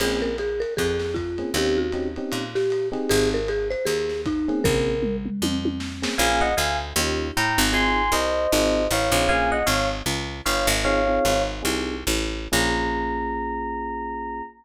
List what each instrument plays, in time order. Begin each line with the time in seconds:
0.00 electric bass (finger) A#1, electric piano 1 A#3 C4 C#4 G#4, marimba G#4, crash, ride
0.22 marimba A#4
0.38 marimba G#4, hi-hat pedal, ride
0.60 marimba A#4, ride
0.77 electric bass (finger) F2, marimba G#4, kick, ride
0.99 snare
1.14 marimba F4, kick, hi-hat pedal, ride
1.38 electric piano 1 A#3 C4 C#4 G#4, ride
1.54 electric bass (finger) D#2, electric piano 1 C4 C#4 D#4 G4, marimba G4, ride
1.77 marimba F#4
1.92 electric piano 1 C4 C#4 D#4 G4, hi-hat pedal, ride
2.16 electric piano 1 C4 C#4 D#4 G4, ride
2.32 electric bass (finger) A#2, ride
2.55 marimba G4, snare
2.70 hi-hat pedal, ride
2.92 electric piano 1 C4 D#4 G4 G#4, ride
3.09 electric bass (finger) G#1, marimba G#4, ride
3.34 marimba A#4
3.48 marimba G#4, hi-hat pedal, ride
3.70 marimba C5, ride
3.85 electric bass (finger) D#2, marimba G#4, ride
4.09 snare
4.26 marimba D#4, kick, hi-hat pedal, ride
4.48 electric piano 1 A#3 C4 C#4 G#4, ride
4.64 electric bass (finger) A#1, marimba A#4, kick, floor tom
5.03 mid tom
5.26 mid tom
5.42 electric bass (finger) F2, high tom
5.65 high tom
5.80 snare
6.02 electric piano 1 A#3 C4 C#4 G#4, snare
6.18 electric bass (finger) A#1, electric piano 1 A#3 C#4 F4 G#4 F5 G#5
6.41 electric piano 1 D#5 F#5
6.57 electric bass (finger) D2, electric piano 1 F5 G#5
6.96 electric bass (finger) D#2, electric piano 1 C#4 D#4 F4 G4
7.37 electric bass (finger) A2, electric piano 1 G5 A#5
7.58 electric bass (finger) G#1
7.72 electric piano 1 C4 D#4 F4 G#4 G#5 C6
8.12 electric bass (finger) C2, electric piano 1 C5 D#5
8.52 electric bass (finger) G#1, electric piano 1 C4 D#4 F4 G#4
8.91 electric bass (finger) A1, electric piano 1 C#5 F5
9.12 electric bass (finger) A#1, electric piano 1 C4 D#4 F4 G#4
9.29 electric piano 1 A#3 C#4 F4 G#4 F5 G#5
9.52 electric piano 1 D#5 F#5
9.66 electric bass (finger) G#1, electric piano 1 C#5 F5
10.06 electric bass (finger) C#2
10.45 electric bass (finger) G1, electric piano 1 C#5 F5
10.67 electric bass (finger) G#1
10.84 electric piano 1 C4 D#4 F4 G#4 C#5 F5
11.07 electric piano 1 C4 D#4 F4 G#4
11.25 electric bass (finger) G#1
11.63 electric bass (finger) C2, electric piano 1 C4 D#4 F4 G#4
12.07 electric bass (finger) A1
12.52 electric bass (finger) A#1, electric piano 1 A#3 C#4 F4 G#4 A#5